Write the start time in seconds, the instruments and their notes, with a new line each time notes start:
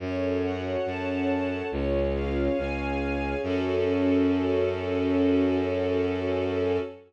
0.00 violin F#2, string ensemble 1 C#4 F#4 A4 C#5
0.43 string ensemble 1 F#5
0.86 violin F#2, string ensemble 1 C#4 A4 C#5 A5
1.29 string ensemble 1 C#5
1.72 violin C#2, string ensemble 1 C#4 F4 G#4 C#5
2.14 string ensemble 1 F5
2.57 violin C#2, string ensemble 1 C#4 G#4 C#5 G#5
3.01 string ensemble 1 C#5
3.43 violin F#2, string ensemble 1 C#4 F#4 A4